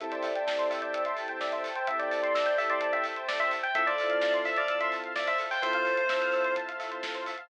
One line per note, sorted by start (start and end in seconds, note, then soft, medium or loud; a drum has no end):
0.00 0.21 A1 medium
0.00 1.68 C4 medium
0.00 1.68 E4 medium
0.00 1.68 G4 medium
0.00 1.68 A4 medium
0.00 0.11 A4 medium
0.00 3.71 C5 medium
0.00 0.11 E5 loud
0.00 3.71 E5 medium
0.00 3.71 G5 medium
0.00 3.71 A5 medium
0.00 kick medium
0.00 closed hi-hat medium
0.12 0.23 C5 medium
0.12 0.69 D5 medium
0.12 closed hi-hat medium
0.23 0.42 A1 medium
0.23 0.34 E5 medium
0.23 open hi-hat medium
0.35 0.46 G5 medium
0.35 closed hi-hat medium
0.46 0.66 A1 medium
0.46 0.57 A5 medium
0.46 kick medium
0.46 snare loud
0.58 0.69 C6 medium
0.58 closed hi-hat medium
0.70 0.90 A1 medium
0.70 0.82 E5 medium
0.70 0.81 E6 medium
0.70 open hi-hat medium
0.82 1.03 D5 medium
0.82 0.92 G6 medium
0.82 closed hi-hat medium
0.93 1.14 A1 medium
0.93 1.04 E6 medium
0.93 kick medium
0.93 closed hi-hat medium
1.05 1.17 E5 medium
1.05 1.16 C6 medium
1.05 closed hi-hat medium
1.17 1.37 A1 medium
1.17 1.28 A5 medium
1.17 open hi-hat medium
1.28 1.39 G5 medium
1.28 closed hi-hat medium
1.40 1.60 A1 medium
1.40 1.52 D5 medium
1.40 1.51 E5 medium
1.40 kick medium
1.40 snare medium
1.52 1.63 C5 medium
1.52 1.63 E5 medium
1.52 closed hi-hat medium
1.64 1.84 A1 medium
1.64 1.75 A4 medium
1.64 open hi-hat medium
1.75 1.86 C5 medium
1.75 1.87 G5 medium
1.75 closed hi-hat medium
1.87 2.06 A1 medium
1.87 3.56 C4 medium
1.87 3.56 E4 medium
1.87 3.56 G4 medium
1.87 3.56 A4 medium
1.87 1.99 E5 medium
1.87 1.98 E5 medium
1.87 kick medium
1.87 closed hi-hat medium
1.99 2.56 D5 medium
1.99 2.10 G5 medium
1.99 closed hi-hat medium
2.11 2.32 A1 medium
2.11 2.21 A5 medium
2.11 open hi-hat medium
2.22 2.33 C6 medium
2.22 closed hi-hat medium
2.34 2.54 A1 medium
2.34 2.45 E6 medium
2.34 kick medium
2.34 snare loud
2.46 2.57 G6 medium
2.46 closed hi-hat medium
2.58 2.78 A1 medium
2.58 2.69 E5 medium
2.58 2.69 E6 medium
2.58 open hi-hat medium
2.70 2.91 D5 medium
2.70 2.80 C6 medium
2.70 closed hi-hat medium
2.81 3.01 A1 medium
2.81 2.92 A5 medium
2.81 kick medium
2.81 closed hi-hat medium
2.93 3.04 E5 medium
2.93 3.04 G5 medium
2.93 closed hi-hat medium
3.04 3.24 A1 medium
3.04 3.15 E5 medium
3.04 open hi-hat medium
3.16 3.27 C5 medium
3.16 closed hi-hat medium
3.28 3.48 A1 medium
3.28 3.39 A4 medium
3.28 3.39 D5 medium
3.28 kick medium
3.28 snare loud
3.39 3.50 C5 medium
3.39 3.51 E5 medium
3.39 closed hi-hat medium
3.51 3.72 A1 medium
3.51 3.62 E5 medium
3.51 open hi-hat medium
3.63 3.74 G5 medium
3.63 closed hi-hat medium
3.75 3.95 F2 medium
3.75 5.44 C4 medium
3.75 5.44 E4 medium
3.75 5.44 F4 medium
3.75 5.44 A4 medium
3.75 3.85 A4 medium
3.75 7.47 C5 medium
3.75 3.86 E5 medium
3.75 7.47 E5 medium
3.75 7.47 F5 medium
3.75 7.47 A5 medium
3.75 kick loud
3.75 closed hi-hat medium
3.87 3.97 C5 medium
3.87 4.36 D5 medium
3.87 closed hi-hat medium
3.98 4.18 F2 medium
3.98 4.09 E5 medium
3.98 open hi-hat medium
4.10 4.21 F5 medium
4.10 closed hi-hat medium
4.21 4.42 F2 medium
4.21 4.32 A5 medium
4.21 kick medium
4.21 snare medium
4.34 4.44 C6 medium
4.34 closed hi-hat medium
4.45 4.65 F2 medium
4.45 4.56 E5 medium
4.45 4.56 E6 medium
4.45 open hi-hat medium
4.56 4.78 D5 medium
4.56 4.67 F6 medium
4.56 closed hi-hat medium
4.68 4.89 F2 medium
4.68 4.79 E6 medium
4.68 kick medium
4.68 closed hi-hat medium
4.80 4.92 E5 medium
4.80 4.91 C6 medium
4.80 closed hi-hat medium
4.92 5.11 F2 medium
4.92 5.03 A5 medium
4.92 open hi-hat medium
5.04 5.14 F5 medium
5.04 closed hi-hat medium
5.16 5.36 F2 medium
5.16 5.27 D5 medium
5.16 5.26 E5 medium
5.16 kick medium
5.16 snare medium
5.27 5.38 C5 medium
5.27 5.39 E5 medium
5.27 closed hi-hat medium
5.38 5.59 F2 medium
5.38 5.50 A4 medium
5.38 open hi-hat medium
5.51 5.62 C5 medium
5.51 5.62 G5 medium
5.51 open hi-hat medium
5.62 5.82 F2 medium
5.62 7.31 C4 medium
5.62 7.31 E4 medium
5.62 7.31 F4 medium
5.62 7.31 A4 medium
5.62 6.53 C5 medium
5.62 5.73 E5 medium
5.62 kick medium
5.62 closed hi-hat medium
5.73 5.85 F5 medium
5.73 closed hi-hat medium
5.85 6.07 F2 medium
5.85 5.96 A5 medium
5.85 open hi-hat medium
5.97 6.08 C6 medium
5.97 closed hi-hat medium
6.08 6.28 F2 medium
6.08 6.20 E6 medium
6.08 kick medium
6.08 snare loud
6.21 6.32 F6 medium
6.21 closed hi-hat medium
6.32 6.53 F2 medium
6.32 6.44 E6 medium
6.32 open hi-hat medium
6.44 6.55 C6 medium
6.44 closed hi-hat medium
6.56 6.76 F2 medium
6.56 6.67 A5 medium
6.56 kick medium
6.56 closed hi-hat medium
6.68 6.79 F5 medium
6.68 closed hi-hat medium
6.79 6.99 F2 medium
6.79 6.90 E5 medium
6.79 open hi-hat medium
6.91 7.02 C5 medium
6.91 closed hi-hat medium
7.03 7.24 F2 medium
7.03 7.14 A4 medium
7.03 kick medium
7.03 snare loud
7.15 7.25 C5 medium
7.15 closed hi-hat medium
7.26 7.47 F2 medium
7.26 7.37 E5 medium
7.26 open hi-hat medium
7.38 7.49 F5 medium
7.38 closed hi-hat medium